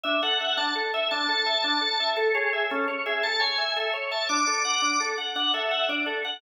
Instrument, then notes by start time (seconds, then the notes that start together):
drawbar organ
0.04 D4 E5
0.23 A4 F#5
0.40 E5
0.57 D4 A5
0.75 A4
0.94 E5
1.11 D4 A5
1.29 A4
1.46 E5
1.64 D4
1.81 A4
2.00 E5
2.17 A4
2.34 G#4 C#5
2.53 E5
2.70 C#4 A4
2.88 C#5
3.06 G#4 E5
3.23 A4 A5
3.40 C#5 G#5
3.58 E5
3.76 A4 E5
3.93 C#5
4.11 E5 A5
4.29 D4 D6
4.46 A4 D6
4.65 F#5
4.82 D4
5.00 A4
5.18 F#5
5.36 D4 F#5
5.54 A4 E5
5.71 F#5
5.89 D4 D5
6.06 A4
6.25 F#5